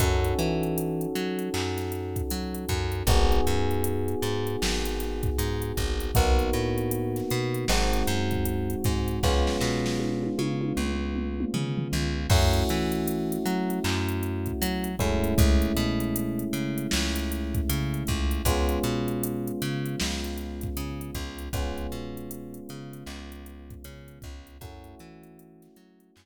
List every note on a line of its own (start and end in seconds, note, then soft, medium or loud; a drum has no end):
0.00 0.34 F#2 loud
0.00 3.03 C#4 medium
0.00 3.03 D#4 medium
0.00 3.03 F#4 medium
0.00 3.03 A4 medium
0.00 kick loud
0.00 closed hi-hat loud
0.25 closed hi-hat medium
0.39 1.07 E3 medium
0.39 closed hi-hat medium
0.63 closed hi-hat medium
0.78 closed hi-hat loud
1.01 closed hi-hat medium
1.15 1.49 F#3 medium
1.15 closed hi-hat medium
1.39 closed hi-hat medium
1.54 2.22 F#2 medium
1.54 clap medium
1.77 snare soft
1.77 closed hi-hat medium
1.92 closed hi-hat medium
2.16 kick medium
2.16 closed hi-hat medium
2.30 2.65 F#3 medium
2.30 closed hi-hat medium
2.54 closed hi-hat medium
2.69 3.03 F#2 loud
2.69 kick medium
2.69 closed hi-hat medium
2.92 closed hi-hat medium
3.07 3.41 G#1 loud
3.07 6.11 B3 medium
3.07 6.11 D#4 medium
3.07 6.11 F#4 medium
3.07 6.11 G#4 medium
3.07 kick loud
3.07 closed hi-hat loud
3.32 closed hi-hat medium
3.47 4.15 F#2 medium
3.47 closed hi-hat medium
3.71 closed hi-hat medium
3.84 closed hi-hat loud
4.08 closed hi-hat medium
4.22 4.56 G#2 medium
4.22 closed hi-hat medium
4.47 closed hi-hat medium
4.62 5.30 G#1 medium
4.62 snare loud
4.85 closed hi-hat medium
5.00 snare soft
5.00 closed hi-hat medium
5.23 kick medium
5.23 closed hi-hat medium
5.38 5.72 G#2 medium
5.38 closed hi-hat loud
5.62 closed hi-hat medium
5.77 6.11 G#1 medium
5.77 kick medium
5.77 closed hi-hat medium
6.00 closed hi-hat medium
6.15 6.50 B1 loud
6.15 7.67 A#3 medium
6.15 7.67 B3 medium
6.15 7.67 D#4 medium
6.15 7.67 F#4 medium
6.15 kick loud
6.15 closed hi-hat loud
6.39 closed hi-hat medium
6.53 7.22 A2 medium
6.53 closed hi-hat medium
6.78 closed hi-hat medium
6.91 closed hi-hat loud
7.16 snare soft
7.16 closed hi-hat medium
7.30 7.65 B2 medium
7.30 closed hi-hat medium
7.54 closed hi-hat medium
7.68 8.03 G#1 loud
7.68 9.20 G#3 medium
7.68 9.20 C4 medium
7.68 9.20 D#4 medium
7.68 9.20 F#4 medium
7.68 snare loud
7.93 closed hi-hat medium
8.07 8.75 F#2 loud
8.07 closed hi-hat medium
8.31 kick medium
8.31 closed hi-hat medium
8.46 closed hi-hat loud
8.70 closed hi-hat medium
8.84 9.19 G#2 medium
8.84 kick medium
8.84 snare soft
8.84 closed hi-hat medium
9.08 closed hi-hat medium
9.23 9.57 C#2 loud
9.23 12.26 G#3 medium
9.23 12.26 B3 medium
9.23 12.26 C#4 medium
9.23 12.26 F4 medium
9.23 kick medium
9.23 snare medium
9.47 snare medium
9.61 10.29 B2 loud
9.61 snare medium
9.86 snare medium
10.00 high tom medium
10.23 high tom medium
10.38 10.73 C#3 medium
10.38 high tom medium
10.61 high tom medium
10.77 11.45 C#2 medium
10.77 mid tom medium
11.16 mid tom medium
11.40 mid tom medium
11.54 11.88 C#3 medium
11.54 floor tom medium
11.78 floor tom medium
11.92 12.27 C#2 medium
11.92 floor tom medium
12.30 12.64 F#2 loud
12.30 14.89 A3 medium
12.30 14.89 C#4 medium
12.30 14.89 E4 medium
12.30 14.89 F#4 medium
12.30 kick loud
12.30 crash loud
12.54 closed hi-hat medium
12.69 13.38 E3 medium
12.69 snare soft
12.69 closed hi-hat medium
12.92 closed hi-hat medium
13.08 closed hi-hat loud
13.32 closed hi-hat medium
13.46 13.80 F#3 medium
13.46 closed hi-hat medium
13.70 closed hi-hat medium
13.84 14.52 F#2 loud
13.84 clap loud
14.09 closed hi-hat medium
14.23 closed hi-hat medium
14.46 kick medium
14.46 closed hi-hat medium
14.62 14.96 F#3 loud
14.62 closed hi-hat loud
14.84 closed hi-hat medium
14.99 15.34 F#2 medium
14.99 18.41 G#3 medium
14.99 18.41 A3 medium
14.99 18.41 C#4 medium
14.99 18.41 E4 medium
14.99 kick medium
14.99 closed hi-hat medium
15.24 closed hi-hat medium
15.38 15.72 C#2 loud
15.38 kick loud
15.38 closed hi-hat loud
15.62 closed hi-hat medium
15.77 16.45 B2 medium
15.77 closed hi-hat medium
16.00 closed hi-hat medium
16.16 closed hi-hat loud
16.39 closed hi-hat medium
16.53 16.87 C#3 medium
16.53 closed hi-hat medium
16.78 closed hi-hat medium
16.91 17.61 C#2 loud
16.91 snare loud
17.16 closed hi-hat medium
17.32 closed hi-hat medium
17.54 kick medium
17.54 closed hi-hat medium
17.69 18.04 C#3 medium
17.69 closed hi-hat loud
17.94 closed hi-hat medium
18.07 18.42 C#2 medium
18.07 kick medium
18.07 closed hi-hat medium
18.31 closed hi-hat medium
18.45 18.79 C#2 loud
18.45 21.49 G#3 medium
18.45 21.49 B3 medium
18.45 21.49 C#4 medium
18.45 21.49 F4 medium
18.45 kick medium
18.45 closed hi-hat loud
18.69 closed hi-hat medium
18.83 19.52 B2 medium
18.83 closed hi-hat medium
19.08 closed hi-hat medium
19.24 closed hi-hat loud
19.47 closed hi-hat medium
19.62 19.96 C#3 loud
19.62 closed hi-hat medium
19.86 closed hi-hat medium
20.00 20.69 C#2 medium
20.00 snare loud
20.24 closed hi-hat medium
20.38 closed hi-hat medium
20.61 kick medium
20.61 closed hi-hat medium
20.77 21.11 C#3 medium
20.77 closed hi-hat loud
21.01 closed hi-hat medium
21.15 21.49 C#2 medium
21.15 kick medium
21.15 closed hi-hat medium
21.39 closed hi-hat medium
21.53 21.87 C#2 loud
21.53 24.57 G#3 medium
21.53 24.57 B3 medium
21.53 24.57 C#4 medium
21.53 24.57 F4 medium
21.53 kick loud
21.53 closed hi-hat loud
21.78 closed hi-hat medium
21.92 22.60 B2 medium
21.92 closed hi-hat medium
22.17 closed hi-hat medium
22.31 closed hi-hat loud
22.54 closed hi-hat medium
22.69 23.04 C#3 medium
22.69 closed hi-hat medium
22.93 closed hi-hat medium
23.06 23.75 C#2 medium
23.06 clap medium
23.32 closed hi-hat medium
23.46 closed hi-hat medium
23.70 kick medium
23.70 closed hi-hat medium
23.84 24.19 C#3 medium
23.84 closed hi-hat loud
24.08 closed hi-hat medium
24.22 24.58 C#2 medium
24.22 kick loud
24.22 closed hi-hat medium
24.47 closed hi-hat medium
24.61 24.95 F#2 medium
24.61 26.26 A3 medium
24.61 26.26 C#4 medium
24.61 26.26 E4 medium
24.61 26.26 F#4 medium
24.61 kick loud
24.61 closed hi-hat loud
24.84 closed hi-hat medium
24.99 25.68 E3 loud
24.99 closed hi-hat medium
25.23 closed hi-hat medium
25.39 closed hi-hat loud
25.62 snare soft
25.62 closed hi-hat medium
25.76 26.11 F#3 medium
25.76 closed hi-hat medium
26.00 closed hi-hat medium
26.16 26.26 F#2 loud
26.16 clap loud